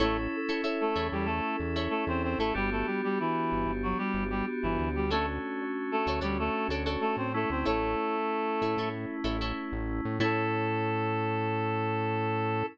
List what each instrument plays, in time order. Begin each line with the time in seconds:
0.00 synth bass 1 A1, clarinet A3 A4, electric piano 2 C#4 E4 A4, acoustic guitar (steel) E4 A4 C#5
0.49 acoustic guitar (steel) E4 A4 C#5
0.64 acoustic guitar (steel) E4 A4 C#5
0.81 clarinet A3 A4
0.95 synth bass 1 E2, acoustic guitar (steel) E4 A4 C#5
1.12 synth bass 1 E2, clarinet G3 G4
1.25 clarinet A3 A4
1.60 synth bass 1 E2
1.76 acoustic guitar (steel) E4 A4 C#5
1.90 clarinet A3 A4
2.07 synth bass 1 E2, clarinet C4 C5
2.23 clarinet C4 C5
2.38 synth bass 1 A1, clarinet A3 A4, acoustic guitar (steel) E4 A4 C#5
2.54 synth bass 1 G1, clarinet G3 G4, electric piano 2 B3 D4 F#4 G4
2.72 clarinet A3 A4
2.86 clarinet G3 G4
3.04 clarinet G3 G4
3.20 clarinet E3 E4
3.52 synth bass 1 G1
3.66 synth bass 1 G1
3.83 clarinet F#3 F#4
3.98 clarinet G3 G4
4.14 synth bass 1 G1
4.30 clarinet G3 G4
4.63 synth bass 1 G1, clarinet E3 E4
4.78 synth bass 1 D2
4.95 clarinet G3 G4
5.11 clarinet A3 A4, electric piano 2 A3 C#4 D4 F#4, acoustic guitar (steel) F#4 A4 C#5 D5
5.91 clarinet A3 A4
6.07 synth bass 1 D2, acoustic guitar (steel) F#4 A4 C#5 D5
6.21 synth bass 1 D2, clarinet G3 G4, acoustic guitar (steel) F#4 A4 C#5 D5
6.39 clarinet A3 A4
6.68 synth bass 1 D2, acoustic guitar (steel) F#4 A4 C#5 D5
6.86 acoustic guitar (steel) F#4 A4 C#5 D5
7.01 clarinet A3 A4
7.17 synth bass 1 A2, clarinet C4 C5
7.34 electric piano 2 A3 C#4 E4, clarinet A3 A4
7.50 synth bass 1 D2, clarinet C4 C5
7.65 synth bass 1 A1, clarinet A3 A4, acoustic guitar (steel) E4 A4 C#5
8.62 synth bass 1 A2, acoustic guitar (steel) E4 A4 C#5
8.77 synth bass 1 A2, acoustic guitar (steel) E4 A4 C#5
9.24 synth bass 1 A1, acoustic guitar (steel) E4 A4 C#5
9.41 acoustic guitar (steel) E4 A4 C#5
9.72 synth bass 1 A1
10.05 synth bass 1 A2
10.20 synth bass 1 A2, electric piano 2 C#4 E4 A4, acoustic guitar (steel) E4 A4 C#5, clarinet A4